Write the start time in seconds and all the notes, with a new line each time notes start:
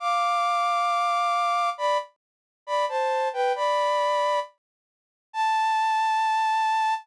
0.00 F5 D6
1.78 D5 B5
2.67 D5 B5
2.89 C5 A5
3.33 B4 G5
3.56 D5 B5
5.33 A5